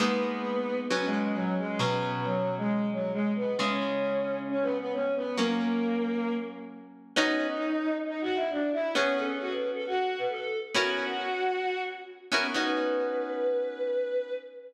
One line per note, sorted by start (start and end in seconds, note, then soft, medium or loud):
0.00 0.87 G#3 medium
0.00 0.87 A#3 medium
0.00 0.78 B3 loud
0.00 0.87 B3 medium
0.00 0.87 D#4 medium
0.90 1.78 F#3 medium
0.90 1.04 B3 medium
0.90 1.78 B3 medium
0.90 1.78 C#4 medium
1.05 1.19 G#3 medium
1.21 1.35 G#3 medium
1.34 1.54 F#3 loud
1.58 1.78 G#3 medium
1.78 3.55 B2 medium
1.78 3.55 F#3 medium
1.78 2.10 B3 medium
1.78 3.55 C#4 medium
2.12 2.23 B3 medium
2.24 2.55 F#3 medium
2.57 2.87 G#3 medium
2.92 3.11 F#3 medium
3.13 3.31 G#3 medium
3.35 3.55 B3 medium
3.58 5.34 C#3 medium
3.58 5.34 G#3 medium
3.58 4.38 C#4 medium
3.58 5.34 E4 medium
4.49 4.63 C#4 loud
4.62 4.76 B3 loud
4.78 4.92 B3 medium
4.93 5.12 C#4 medium
5.15 5.36 B3 medium
5.37 7.13 F#3 medium
5.37 6.32 A#3 loud
5.37 7.13 A#3 medium
5.37 7.13 C#4 medium
7.16 7.48 B3 loud
7.16 7.48 C#4 loud
7.16 7.94 D#4 loud
7.16 7.48 D#4 loud
7.16 7.48 F#4 loud
8.06 8.20 D#4 loud
8.21 8.36 F#4 loud
8.35 8.49 E4 medium
8.50 8.69 D4 loud
8.73 8.92 E4 loud
8.95 9.26 B3 loud
8.95 9.14 C#4 loud
8.95 9.26 C#4 loud
8.95 9.26 F#4 loud
8.95 9.26 G#4 loud
9.17 9.35 A4 loud
9.40 9.51 F#4 medium
9.51 9.69 B4 medium
9.74 9.85 A4 medium
9.86 10.19 F#4 medium
10.18 10.29 B4 loud
10.29 10.59 A4 medium
10.74 11.06 B3 loud
10.74 11.06 C#4 loud
10.74 11.06 E4 loud
10.74 11.81 F#4 loud
10.74 11.06 F#4 loud
10.74 11.06 A#4 loud
12.32 12.47 B3 medium
12.32 12.47 C#4 loud
12.32 12.47 E4 medium
12.32 12.47 F#4 loud
12.32 12.47 A#4 medium
12.54 14.32 B3 loud
12.54 14.32 C#4 medium
12.54 14.32 D#4 medium
12.54 14.32 F#4 loud
12.54 14.33 B4 loud